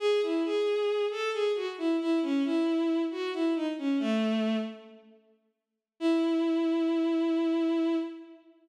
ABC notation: X:1
M:9/8
L:1/16
Q:3/8=90
K:E
V:1 name="Violin"
G2 E2 G6 A2 G2 F z E2 | E2 C2 E6 F2 E2 D z C2 | A,6 z12 | E18 |]